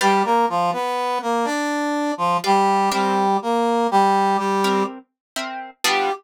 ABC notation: X:1
M:12/8
L:1/8
Q:3/8=82
K:G
V:1 name="Brass Section"
[G,G] [_B,_B] [=F,=F] [=B,=B]2 [_B,_B] [Dd]3 [F,F] [G,G]2 | [G,G]2 [_B,_B]2 [G,G]2 [G,G]2 z4 | G3 z9 |]
V:2 name="Acoustic Guitar (steel)"
[GBd=f]10 [GBdf]2 | [C_Beg]7 [CBeg]3 [CBeg]2 | [G,B,D=F]3 z9 |]